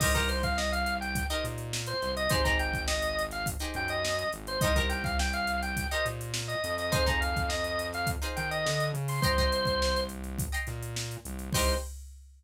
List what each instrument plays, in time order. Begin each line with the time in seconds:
0.00 synth bass 1 C2, pizzicato strings D#4 G4 A#4 C5, drawbar organ D#5, kick, crash
0.14 pizzicato strings D#4 G4 A#4 C5, drawbar organ A#4, kick, closed hi-hat
0.29 drawbar organ C5, closed hi-hat
0.43 drawbar organ F5, kick, closed hi-hat
0.57 drawbar organ D#5, snare
0.71 drawbar organ F5, snare, closed hi-hat
0.86 closed hi-hat
1.01 drawbar organ G5, closed hi-hat
1.15 kick, closed hi-hat
1.30 pizzicato strings D#4 G4 A#4 C5, drawbar organ D#5, closed hi-hat
1.44 synth bass 1 A#2, snare, closed hi-hat
1.58 closed hi-hat
1.73 snare
1.86 drawbar organ C5, closed hi-hat
2.02 synth bass 1 C2, snare, closed hi-hat
2.17 drawbar organ D#5, closed hi-hat
2.29 synth bass 1 G#1, pizzicato strings D#4 G4 G#4 C5, drawbar organ C5, kick, closed hi-hat
2.44 pizzicato strings D#4 G4 G#4 C5, drawbar organ A#5, kick, closed hi-hat
2.59 drawbar organ G5, closed hi-hat
2.74 kick, closed hi-hat
2.88 drawbar organ D#5, snare
3.02 snare, closed hi-hat
3.19 closed hi-hat
3.31 drawbar organ F5, snare, closed hi-hat
3.46 kick, closed hi-hat
3.59 pizzicato strings D#4 G4 G#4 C5, closed hi-hat
3.74 synth bass 1 F#2, drawbar organ G5, closed hi-hat
3.88 drawbar organ D#5, closed hi-hat
4.05 snare
4.19 closed hi-hat
4.33 synth bass 1 G#1, closed hi-hat
4.47 drawbar organ C5, closed hi-hat
4.61 synth bass 1 C2, pizzicato strings D#4 G4 A#4 C5, drawbar organ D#5, kick, closed hi-hat
4.76 pizzicato strings D#4 G4 A#4 C5, drawbar organ A#4, kick, closed hi-hat
4.89 drawbar organ G5, snare, closed hi-hat
5.04 drawbar organ F5, kick, snare, closed hi-hat
5.19 drawbar organ G5, snare
5.33 drawbar organ F5, closed hi-hat
5.47 closed hi-hat
5.62 drawbar organ G5, closed hi-hat
5.77 kick, closed hi-hat
5.91 pizzicato strings D#4 G4 A#4 C5, drawbar organ D#5, closed hi-hat
6.06 synth bass 1 A#2, closed hi-hat
6.21 closed hi-hat
6.34 snare
6.48 drawbar organ D#5, closed hi-hat
6.64 synth bass 1 F2, closed hi-hat
6.78 drawbar organ D#5, snare, closed hi-hat
6.92 pizzicato strings D#4 F4 G#4 C5, drawbar organ C5, kick, closed hi-hat
7.06 pizzicato strings D#4 F4 G#4 C5, drawbar organ A#5, kick, closed hi-hat
7.21 drawbar organ F5, closed hi-hat
7.36 kick, closed hi-hat
7.49 drawbar organ D#5, snare
7.64 closed hi-hat
7.79 closed hi-hat
7.93 drawbar organ F5, snare, closed hi-hat
8.07 kick, closed hi-hat
8.22 pizzicato strings D#4 F4 G#4 C5, closed hi-hat
8.36 synth bass 1 D#3, drawbar organ G5, closed hi-hat
8.51 drawbar organ D#5, closed hi-hat
8.66 synth bass 1 D3, snare
8.80 closed hi-hat
8.94 synth bass 1 C#3, closed hi-hat
9.08 drawbar organ C6, open hi-hat
9.22 synth bass 1 C2, drawbar organ C5, pizzicato strings D#5 G5 A#5 C6, kick, closed hi-hat
9.38 pizzicato strings D#5 G5 A#5 C6, kick, closed hi-hat
9.52 closed hi-hat
9.65 kick, closed hi-hat
9.82 snare
9.96 closed hi-hat
10.09 closed hi-hat
10.24 closed hi-hat
10.38 kick, closed hi-hat
10.52 pizzicato strings D#5 G5 A#5 C6, closed hi-hat
10.67 synth bass 1 A#2, snare, closed hi-hat
10.82 closed hi-hat
10.96 snare
11.11 snare, closed hi-hat
11.25 synth bass 1 C2, closed hi-hat
11.39 closed hi-hat
11.53 synth bass 1 C2, pizzicato strings D#4 G4 A#4 C5, drawbar organ C5, kick, crash